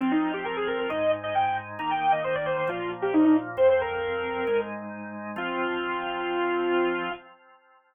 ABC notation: X:1
M:4/4
L:1/16
Q:1/4=134
K:Fdor
V:1 name="Lead 2 (sawtooth)"
C E2 G B A B B e2 z e g g z2 | b g2 e c d c c F2 z G E E z2 | c c B8 z6 | F16 |]
V:2 name="Drawbar Organ"
[F,CF]8 [A,,A,E]8 | [E,B,E]8 [B,,F,B,]8 | [F,,F,C]8 [A,,A,E]8 | [F,CF]16 |]